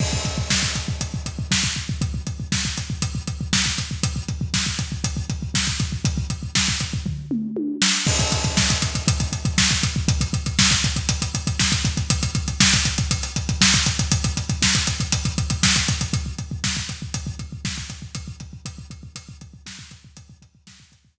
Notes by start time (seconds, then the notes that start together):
0.00 kick, crash
0.13 kick
0.25 kick, closed hi-hat
0.38 kick
0.50 kick, snare
0.63 kick
0.76 kick, closed hi-hat
0.88 kick
1.01 kick, closed hi-hat
1.14 kick
1.26 kick, closed hi-hat
1.39 kick
1.51 kick, snare
1.64 kick
1.76 kick
1.89 kick
2.01 kick, closed hi-hat
2.14 kick
2.27 kick, closed hi-hat
2.40 kick
2.52 kick, snare
2.65 kick
2.78 kick, closed hi-hat
2.90 kick
3.02 kick, closed hi-hat
3.15 kick
3.27 kick, closed hi-hat
3.41 kick
3.53 kick, snare
3.66 kick
3.78 kick, closed hi-hat
3.91 kick
4.03 kick, closed hi-hat
4.16 kick
4.28 kick, closed hi-hat
4.41 kick
4.54 kick, snare
4.66 kick
4.79 kick, closed hi-hat
4.92 kick
5.04 kick, closed hi-hat
5.17 kick
5.30 kick, closed hi-hat
5.42 kick
5.54 kick, snare
5.67 kick
5.80 kick, closed hi-hat
5.92 kick
6.05 kick, closed hi-hat
6.18 kick
6.30 kick, closed hi-hat
6.43 kick
6.55 kick, snare
6.68 kick
6.80 kick, closed hi-hat
6.93 kick
7.06 kick, floor tom
7.31 mid tom
7.57 high tom
7.82 snare
8.07 kick, crash
8.19 kick, closed hi-hat
8.32 kick, closed hi-hat
8.44 kick, closed hi-hat
8.57 kick, snare
8.70 kick, closed hi-hat
8.82 kick, closed hi-hat
8.95 kick, closed hi-hat
9.08 kick, closed hi-hat
9.20 kick, closed hi-hat
9.32 kick, closed hi-hat
9.45 kick, closed hi-hat
9.58 kick, snare
9.70 kick, closed hi-hat
9.83 kick, closed hi-hat
9.96 kick
10.08 kick, closed hi-hat
10.21 kick, closed hi-hat
10.33 kick, closed hi-hat
10.46 kick, closed hi-hat
10.59 kick, snare
10.71 kick, closed hi-hat
10.84 kick, closed hi-hat
10.96 kick, closed hi-hat
11.09 kick, closed hi-hat
11.22 kick, closed hi-hat
11.35 kick, closed hi-hat
11.47 kick, closed hi-hat
11.59 kick, snare
11.72 kick, closed hi-hat
11.85 kick, closed hi-hat
11.97 kick, closed hi-hat
12.10 kick, closed hi-hat
12.23 kick, closed hi-hat
12.35 kick, closed hi-hat
12.48 kick, closed hi-hat
12.60 kick, snare
12.74 kick, closed hi-hat
12.85 kick, closed hi-hat
12.98 kick, closed hi-hat
13.11 kick, closed hi-hat
13.23 closed hi-hat
13.36 kick, closed hi-hat
13.49 kick, closed hi-hat
13.61 kick, snare
13.74 kick, closed hi-hat
13.86 kick, closed hi-hat
13.99 kick, closed hi-hat
14.12 kick, closed hi-hat
14.24 kick, closed hi-hat
14.37 kick, closed hi-hat
14.49 kick, closed hi-hat
14.62 kick, snare
14.75 kick, closed hi-hat
14.87 kick, closed hi-hat
15.00 kick, closed hi-hat
15.12 kick, closed hi-hat
15.25 kick, closed hi-hat
15.38 kick, closed hi-hat
15.50 kick, closed hi-hat
15.63 kick, snare
15.76 kick, closed hi-hat
15.88 kick, closed hi-hat
16.01 kick, closed hi-hat
16.13 kick, closed hi-hat
16.26 kick
16.38 kick, closed hi-hat
16.51 kick
16.64 kick, snare
16.77 kick
16.89 kick, closed hi-hat
17.02 kick
17.14 kick, closed hi-hat
17.27 kick
17.39 kick, closed hi-hat
17.52 kick
17.65 kick, snare
17.78 kick
17.90 kick, closed hi-hat
18.02 kick
18.15 kick, closed hi-hat
18.28 kick
18.40 kick, closed hi-hat
18.53 kick
18.65 kick, closed hi-hat
18.78 kick
18.90 kick, closed hi-hat
19.03 kick
19.16 kick, closed hi-hat
19.29 kick
19.41 kick, closed hi-hat
19.54 kick
19.66 kick, snare
19.79 kick
19.91 kick, closed hi-hat
20.04 kick
20.17 kick, closed hi-hat
20.30 kick
20.42 kick, closed hi-hat
20.55 kick
20.67 kick, snare
20.80 kick
20.92 kick, closed hi-hat
21.05 kick